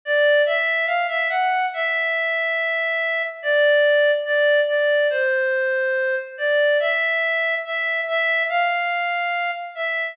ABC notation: X:1
M:4/4
L:1/16
Q:1/4=71
K:Dm
V:1 name="Clarinet"
d2 e2 f e _g2 e8 | d4 d2 d2 c6 d2 | e4 e2 e2 f6 e2 |]